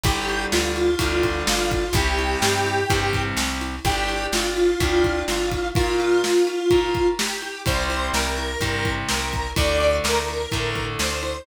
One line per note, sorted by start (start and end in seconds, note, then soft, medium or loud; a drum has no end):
0.03 0.46 G1 loud
0.03 0.90 D3 loud
0.03 0.90 G3 loud
0.03 0.45 G4 medium
0.03 kick loud
0.03 ride loud
0.29 ride medium
0.52 0.96 D2 medium
0.52 1.43 F4 medium
0.52 snare loud
0.76 ride medium
0.99 1.43 D2 medium
0.99 1.85 D3 loud
0.99 1.85 G3 medium
0.99 kick medium
0.99 ride loud
1.23 kick medium
1.23 ride medium
1.47 1.90 G1 medium
1.47 1.93 F4 medium
1.47 snare loud
1.71 kick medium
1.71 ride medium
1.93 2.36 C2 loud
1.93 2.80 C3 loud
1.93 2.80 G3 loud
1.93 3.22 G4 medium
1.93 kick loud
1.93 ride loud
2.19 ride medium
2.42 2.85 G2 medium
2.42 snare loud
2.66 ride medium
2.90 3.33 G2 loud
2.90 3.76 C3 medium
2.90 3.76 G3 medium
2.90 kick loud
2.90 ride loud
3.13 kick medium
3.13 ride medium
3.37 3.79 C2 medium
3.37 snare loud
3.61 ride medium
3.85 4.27 G1 medium
3.85 4.71 D4 medium
3.85 4.26 G4 medium
3.85 4.71 G4 loud
3.85 kick loud
3.85 ride loud
4.09 ride medium
4.32 4.75 G1 medium
4.32 5.23 F4 medium
4.32 snare loud
4.57 ride medium
4.80 5.23 D2 medium
4.80 5.66 D4 medium
4.80 5.66 G4 medium
4.80 kick loud
4.80 ride loud
5.04 kick medium
5.04 ride medium
5.28 5.71 G1 medium
5.28 5.68 F4 medium
5.28 snare medium
5.51 kick medium
5.51 ride medium
5.75 6.22 F4 medium
5.75 6.61 F4 loud
5.75 6.61 A#4 loud
5.75 kick loud
5.75 ride loud
6.00 ride medium
6.23 7.08 F4 medium
6.23 snare loud
6.47 ride medium
6.71 7.57 F4 medium
6.71 7.57 A#4 medium
6.71 kick medium
6.71 ride medium
6.94 kick medium
6.94 ride medium
7.19 7.62 G4 medium
7.19 snare loud
7.42 ride medium
7.66 8.10 C2 medium
7.66 8.52 C3 medium
7.66 8.52 G3 loud
7.66 8.08 C5 medium
7.66 kick loud
7.66 ride loud
7.90 ride medium
8.13 8.56 C2 medium
8.13 8.92 A#4 medium
8.13 snare loud
8.38 ride medium
8.61 9.03 G2 medium
8.61 9.47 C3 medium
8.61 9.47 G3 medium
8.61 kick medium
8.61 ride loud
8.85 kick medium
8.85 ride medium
9.09 9.54 C2 medium
9.09 9.50 A#4 medium
9.09 snare loud
9.33 kick medium
9.33 ride medium
9.56 10.00 D2 loud
9.56 10.42 D3 medium
9.56 10.42 A3 medium
9.56 9.96 D5 medium
9.56 kick loud
9.56 ride loud
9.80 ride medium
10.04 10.47 D2 medium
10.04 10.85 A#4 medium
10.04 snare loud
10.28 ride medium
10.52 10.96 A2 medium
10.52 11.38 D3 medium
10.52 11.38 A3 medium
10.52 kick medium
10.52 ride medium
10.75 kick medium
10.75 ride medium
10.99 11.42 D2 medium
10.99 11.43 C5 medium
10.99 snare loud
11.23 ride medium